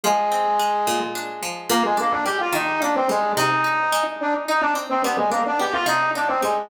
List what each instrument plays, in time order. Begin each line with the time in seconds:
0.03 pizzicato strings F3, flute G#3 G#4
0.32 pizzicato strings C4
0.59 pizzicato strings G#3
0.87 pizzicato strings A#2
1.15 pizzicato strings D4
1.43 pizzicato strings F3
1.69 pizzicato strings A#2, flute A#3 A#4
1.84 flute G#3 G#4
1.97 flute A#3 A#4, pizzicato strings D4
2.11 flute D4 D5
2.25 pizzicato strings G3, flute G4 G5
2.40 flute F4 F5
2.52 pizzicato strings D#3, flute D#4 D#5
2.82 pizzicato strings A#3, flute D4 D5
2.95 flute C4 C5
3.09 pizzicato strings G3, flute G#3 G#4
3.36 pizzicato strings C3, flute D#4 D#5
3.64 pizzicato strings D#4
3.92 pizzicato strings G#3
4.20 flute D4 D5
4.48 pizzicato strings D#4, flute D#4 D#5
4.61 flute D4 D5
4.75 pizzicato strings C4
4.89 flute C4 C5
5.03 pizzicato strings G3, flute B3 B4
5.17 flute G#3 G#4
5.30 flute A#3 A#4, pizzicato strings D4
5.46 flute D4 D5
5.59 pizzicato strings B3, flute G4 G5
5.73 flute F4 F5
5.86 pizzicato strings C3, flute D#4 D#5
6.15 flute D4 D5, pizzicato strings D#4
6.28 flute C4 C5
6.42 pizzicato strings G3, flute G#3 G#4